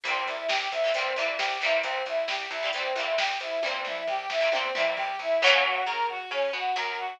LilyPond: <<
  \new Staff \with { instrumentName = "Brass Section" } { \time 4/4 \key c \major \tempo 4 = 134 c'8 e'8 g'8 e'8 c'8 e'8 g'8 e'8 | c'8 e'8 g'8 e'8 c'8 e'8 g'8 e'8 | c'8 e'8 g'8 e'8 c'8 e'8 g'8 e'8 | \key des \major des'8 ges'8 bes'8 ges'8 des'8 ges'8 bes'8 ges'8 | }
  \new Staff \with { instrumentName = "Acoustic Guitar (steel)" } { \time 4/4 \key c \major <e g bes c'>4.~ <e g bes c'>16 <e g bes c'>16 <e g bes c'>8 <e g bes c'>4 <e g bes c'>8~ | <e g bes c'>4.~ <e g bes c'>16 <e g bes c'>16 <e g bes c'>8 <e g bes c'>4. | <e g bes c'>4.~ <e g bes c'>16 <e g bes c'>16 <e g bes c'>8 <e g bes c'>4. | \key des \major <fes ges bes des'>4 des'4 des'8 b8 ges4 | }
  \new Staff \with { instrumentName = "Electric Bass (finger)" } { \clef bass \time 4/4 \key c \major c,8 c,8 c,8 c,8 c,8 c,8 c,8 c,8 | c,8 c,8 c,8 c,8 c,8 c,8 c,8 c,8 | c,8 c,8 c,8 c,8 c,8 c,8 c,8 c,8 | \key des \major ges,4 des4 des8 b,8 ges,4 | }
  \new DrumStaff \with { instrumentName = "Drums" } \drummode { \time 4/4 <hh bd>8 <hh bd>8 sn8 <hh bd>8 <hh bd>8 hh8 sn8 hh8 | <hh bd>8 <hh bd>8 sn8 <hh bd>8 <hh bd>8 hh8 sn8 hh8 | <bd tommh>8 toml8 tomfh8 sn8 tommh8 toml8 tomfh4 | r4 r4 r4 r4 | }
>>